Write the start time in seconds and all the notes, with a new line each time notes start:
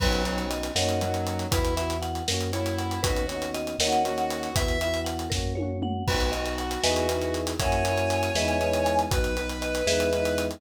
0.00 B1 F#3 B3 C#4 B4, kick, crash
0.05 D#4 F#4
0.13 closed hi-hat
0.25 B3 C#4 C#5, closed hi-hat
0.30 D#4 F#4
0.38 closed hi-hat
0.50 D#5, closed hi-hat
0.63 closed hi-hat
0.75 F#2 A#3 C#4 A#4 C#5 D#5 F#5, snare
0.82 D#4 F#4
0.89 closed hi-hat
1.01 F#3 A#3 C#4, closed hi-hat
1.06 D#4 F#4
1.14 closed hi-hat
1.27 closed hi-hat
1.39 closed hi-hat
1.51 E2 B3 E4 B4, kick, closed hi-hat
1.56 F#4
1.65 closed hi-hat
1.76 B3 E4 E5, closed hi-hat
1.81 F#4
1.90 closed hi-hat
2.02 F#5, closed hi-hat
2.15 closed hi-hat
2.28 F#2 A#3 C#4 A#4, snare
2.34 F#4
2.41 closed hi-hat
2.52 A#3 C#4 E4 C#5, closed hi-hat
2.59 F#4
2.66 closed hi-hat
2.78 F#5, closed hi-hat
2.91 closed hi-hat
3.02 D#2 B3 C#4 F#4 B4, kick, closed hi-hat
3.07 D#4 F#4
3.16 closed hi-hat
3.27 B3 C#5, closed hi-hat
3.32 C#4 D#4
3.37 F#4
3.42 closed hi-hat
3.54 D#5, closed hi-hat
3.67 closed hi-hat
3.79 D#2 A#3 C#4 A#4 C#5 D#5 F#5, snare
3.85 D#4 F#4
3.92 closed hi-hat
4.05 A#3 C#4 F#4, closed hi-hat
4.10 D#4 F#4
4.18 closed hi-hat
4.30 closed hi-hat
4.43 closed hi-hat
4.54 E2 B3 E4 B4 E5, kick, closed hi-hat
4.59 F#4
4.68 closed hi-hat
4.81 B3 E4 E5, closed hi-hat
4.87 F#4
4.94 closed hi-hat
5.05 F#5, closed hi-hat
5.19 closed hi-hat
5.30 F#2 A#3 A#4, kick, snare
5.34 C#4 F#4
5.55 A#3 C#5, high tom
5.60 C#4 F#4
5.82 F#5, mid tom
6.07 B1 B3 F#4 B4, kick, crash
6.11 D#4 F#4
6.20 closed hi-hat
6.32 B3 D#4 D#5, closed hi-hat
6.37 F#4
6.46 closed hi-hat
6.58 F#5, closed hi-hat
6.71 closed hi-hat
6.83 E2 B3 D#4 B4 D#5 E5 G#5, snare
6.88 E4 G#4
6.96 closed hi-hat
7.09 B3 D#4, closed hi-hat
7.14 E4 G#4
7.22 closed hi-hat
7.34 closed hi-hat
7.47 closed hi-hat
7.59 F#2 A#3 C#4 A#4 C#5 E5 F#5 G#5, kick, closed hi-hat
7.65 E4 F#4
7.72 closed hi-hat
7.85 A#3 C#4, closed hi-hat
7.90 E4 F#4
7.97 closed hi-hat
8.10 closed hi-hat
8.23 closed hi-hat
8.35 E2 G#3 B3 G#4 B4 D#5 E5, snare
8.40 D#4 E4
8.48 closed hi-hat
8.61 G#3 B3, closed hi-hat
8.66 D#4 E4
8.73 closed hi-hat
8.86 closed hi-hat
8.99 closed hi-hat
9.11 B1 F#3 B3 F#4 B4, kick, closed hi-hat
9.17 D#4
9.24 closed hi-hat
9.36 F#3 B3 B4, closed hi-hat
9.41 D#4
9.49 closed hi-hat
9.62 D#5, closed hi-hat
9.75 closed hi-hat
9.86 E2 G#3 B3 G#4 B4 D#5 E5, snare
9.92 D#4 E4
10.00 closed hi-hat
10.13 G#3 B3, closed hi-hat
10.18 D#4 E4
10.25 closed hi-hat
10.38 closed hi-hat
10.51 closed hi-hat